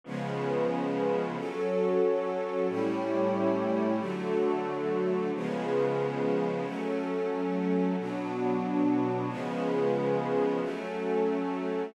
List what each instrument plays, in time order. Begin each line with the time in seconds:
0.04 string ensemble 1 C#3 F3 G#3 B3, pad 5 (bowed) C#4 F4 G#4 B4
1.36 string ensemble 1 F#3 C#4 A4, pad 5 (bowed) F#4 A4 C#5
2.68 string ensemble 1 A2 G3 C#4 E4, pad 5 (bowed) A3 E4 G4 C#5
3.99 string ensemble 1 D3 F#3 A3, pad 5 (bowed) D4 F#4 A4
5.33 string ensemble 1 C#3 F3 G#3 B3, pad 5 (bowed) C#4 F4 G#4 B4
6.65 string ensemble 1 F#3 A3 C#4, pad 5 (bowed) F#3 C#4 A4
7.98 string ensemble 1 B2 F#3 D4, pad 5 (bowed) B3 D4 F#4
9.29 string ensemble 1 C#3 F3 G#3 B3, pad 5 (bowed) C#4 F4 G#4 B4
10.61 string ensemble 1 F#3 A3 C#4, pad 5 (bowed) F#3 C#4 A4